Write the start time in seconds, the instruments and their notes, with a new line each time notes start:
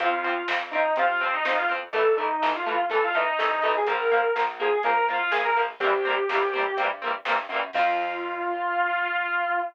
0.00 electric bass (finger) F2, overdriven guitar F3 C4, distortion guitar F4, kick, closed hi-hat
0.24 overdriven guitar F3 C4, closed hi-hat
0.48 electric bass (finger) F2, overdriven guitar F3 C4, snare
0.71 overdriven guitar F3 C4, distortion guitar D#4, closed hi-hat
0.96 electric bass (finger) C3, overdriven guitar F3 C4, distortion guitar F4, kick, closed hi-hat
1.20 overdriven guitar F3 C4, distortion guitar C4, closed hi-hat
1.33 distortion guitar D#4
1.44 electric bass (finger) F2, overdriven guitar F3 C4, distortion guitar D#4, snare
1.56 distortion guitar F4
1.69 overdriven guitar F3 C4, closed hi-hat
1.93 electric bass (finger) A1, overdriven guitar E3 A3, distortion guitar A4, kick, closed hi-hat
2.17 overdriven guitar E3 A3, distortion guitar D#4, closed hi-hat
2.42 electric bass (finger) A1, overdriven guitar E3 A3, snare
2.55 distortion guitar F4
2.66 overdriven guitar E3 A3, distortion guitar F4, closed hi-hat
2.89 electric bass (finger) E2, overdriven guitar E3 A3, distortion guitar A4, kick, closed hi-hat
3.04 distortion guitar F4
3.14 overdriven guitar E3 A3, distortion guitar D#4, closed hi-hat
3.39 electric bass (finger) C2, overdriven guitar E3 A3, snare
3.61 electric bass (finger) B1, overdriven guitar E3 A3, distortion guitar D#4, kick, open hi-hat
3.77 distortion guitar G#4
3.86 electric bass (finger) A#1, overdriven guitar F3 A#3, distortion guitar A#4, kick, closed hi-hat
4.10 overdriven guitar F3 A#3, kick, closed hi-hat
4.35 electric bass (finger) A#1, overdriven guitar F3 A#3, snare
4.60 overdriven guitar F3 A#3, distortion guitar G#4, closed hi-hat
4.83 electric bass (finger) F2, overdriven guitar F3 A#3, distortion guitar A#4, kick, closed hi-hat
5.08 overdriven guitar F3 A#3, distortion guitar F4, closed hi-hat
5.19 distortion guitar F4
5.31 electric bass (finger) A#1, overdriven guitar F3 A#3, distortion guitar G#4, snare
5.44 distortion guitar A#4
5.56 overdriven guitar F3 A#3, open hi-hat
5.80 electric bass (finger) C2, overdriven guitar A#3 C4, distortion guitar G4, kick, closed hi-hat
5.84 overdriven guitar E3 G3
6.05 overdriven guitar G3 A#3 C4, closed hi-hat
6.10 overdriven guitar E3
6.29 electric bass (finger) C2, overdriven guitar G3 A#3 C4, snare
6.35 overdriven guitar E3
6.53 overdriven guitar G3 A#3 C4, kick, closed hi-hat
6.59 overdriven guitar E3
6.77 electric bass (finger) G2, overdriven guitar A#3 C4, kick, closed hi-hat
6.81 overdriven guitar E3 G3
7.02 overdriven guitar G3 A#3 C4, closed hi-hat
7.07 overdriven guitar E3
7.25 electric bass (finger) G2, overdriven guitar A#3 C4, snare
7.30 overdriven guitar E3 G3
7.49 electric bass (finger) F#2, overdriven guitar A#3 C4, closed hi-hat
7.54 overdriven guitar E3 G3
7.73 electric bass (finger) F2, overdriven guitar F3 C4, distortion guitar F4, kick, crash